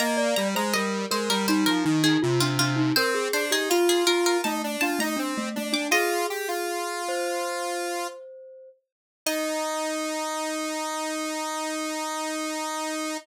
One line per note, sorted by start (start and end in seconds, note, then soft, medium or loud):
0.00 0.35 A#3 loud
0.00 0.17 D#5 loud
0.00 0.30 A#5 medium
0.17 0.48 D5 loud
0.36 0.55 G3 loud
0.36 0.54 A#5 medium
0.55 0.74 G#3 loud
0.55 0.73 C5 loud
0.55 0.74 A#5 medium
0.73 1.06 G3 medium
0.73 1.04 A#4 loud
0.73 1.06 D#5 medium
1.11 1.29 G#3 medium
1.11 1.46 A#4 loud
1.11 1.29 C5 medium
1.30 1.47 G3 loud
1.30 1.48 A#4 medium
1.47 1.65 G3 medium
1.47 1.83 D#4 loud
1.47 1.66 C5 medium
1.66 1.85 F3 medium
1.66 1.99 A#4 medium
1.85 2.18 D#3 loud
1.85 2.02 D#4 loud
2.04 2.21 D#4 loud
2.04 2.21 G#4 medium
2.22 2.40 C3 loud
2.22 2.40 F4 loud
2.40 2.58 C3 medium
2.40 2.59 D4 loud
2.40 2.58 F4 medium
2.59 2.93 C3 medium
2.59 2.78 D4 loud
2.59 2.91 F4 medium
2.76 2.94 D#4 loud
2.96 3.28 C4 loud
2.96 3.15 A#4 loud
2.96 3.27 C5 loud
3.15 3.44 G#4 loud
3.33 3.51 D4 loud
3.33 3.51 C5 medium
3.51 3.69 D#4 medium
3.51 3.69 G4 loud
3.51 3.70 G#4 medium
3.70 4.41 F4 medium
3.70 3.88 F4 medium
3.70 4.04 F4 loud
3.89 4.07 G#4 medium
4.07 4.37 F4 loud
4.07 4.24 A#4 medium
4.26 4.44 A#4 medium
4.44 4.77 A3 loud
4.44 4.62 D#4 medium
4.44 4.77 A5 medium
4.64 4.82 D4 medium
4.81 4.99 D4 loud
4.81 5.00 F4 medium
4.81 4.98 A5 medium
4.99 5.17 A3 loud
4.99 5.19 D#4 loud
4.99 5.18 A#5 medium
5.17 5.49 C4 medium
5.17 5.34 D4 loud
5.38 5.55 A3 loud
5.56 5.75 A3 loud
5.56 5.87 D4 medium
5.73 5.90 D4 loud
5.73 5.91 D6 medium
5.91 6.27 F4 loud
5.91 7.02 G#4 medium
5.91 7.31 D#5 medium
6.30 6.48 G4 medium
6.48 8.07 F4 medium
7.09 8.69 C5 loud
9.26 13.17 D#4 loud
9.26 13.18 D#5 loud